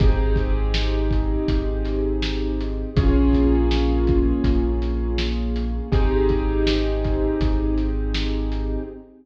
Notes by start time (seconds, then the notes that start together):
0.00 G#1 C4 D#4 G4 G#4, kick, closed hi-hat
0.36 kick, closed hi-hat
0.74 snare
1.11 kick, closed hi-hat
1.48 G#1, kick, closed hi-hat
1.85 snare, closed hi-hat
2.22 snare
2.60 closed hi-hat
2.96 A#1 A#3 C#4 F4 G#4, kick, closed hi-hat
3.33 kick, closed hi-hat
3.71 snare
4.07 kick, closed hi-hat
4.44 A#1, kick, closed hi-hat
4.82 closed hi-hat
5.18 snare
5.56 closed hi-hat
5.92 G#1 C4 D#4 G4 G#4, kick, closed hi-hat
6.29 kick, closed hi-hat
6.67 snare
7.04 kick, closed hi-hat
7.41 G#1, kick, closed hi-hat
7.78 closed hi-hat
8.14 snare
8.52 closed hi-hat